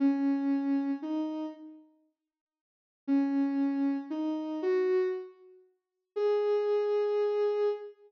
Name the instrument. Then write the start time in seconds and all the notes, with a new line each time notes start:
ocarina
0.00 C#4
1.02 D#4
3.07 C#4
4.10 D#4
4.62 F#4
6.16 G#4